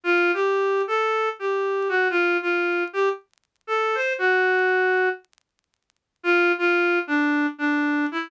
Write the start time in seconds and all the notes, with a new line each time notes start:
0.04 F4
0.34 G4
0.87 A4
1.39 G4
1.89 F#4
2.10 F4
2.42 F4
2.93 G4
3.67 A4
3.95 C5
4.18 F#4
6.23 F4
6.58 F4
7.07 D4
7.58 D4
8.12 E4